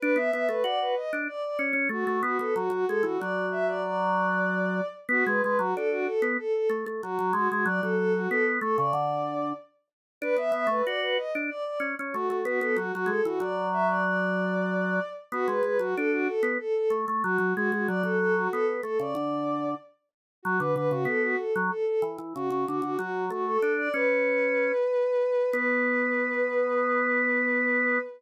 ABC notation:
X:1
M:4/4
L:1/16
Q:1/4=94
K:Bdor
V:1 name="Violin"
B e e B d B _e z d d z2 F2 F A | F F A F d2 e d d8 | F B B F A F A z A A z2 F2 F F | d A A F A z A d5 z4 |
B e e B d B _e z d d z2 F2 F A | F F A F d2 e d d8 | F B B F A F A z A A z2 F2 F F | d A A F A z A d5 z4 |
F B B F A F A z A A z2 F2 F F | F2 F A2 d B10 | B16 |]
V:2 name="Drawbar Organ"
D B, B, A, F2 z D z2 C C A, A, B, B, | F, F, G, E, F,12 | B, G, G, F, D2 z B, z2 A, A, F, F, G, G, | F, F,3 B,2 A, C, D,4 z4 |
D B, B, A, F2 z D z2 C C A, A, B, B, | F, F, G, E, F,12 | B, G, G, F, D2 z B, z2 A, A, F, F, G, G, | F, F,3 B,2 A, C, D,4 z4 |
F, D, D, C, B,2 z F, z2 E, E, C, C, D, D, | F,2 A,2 D2 C6 z4 | B,16 |]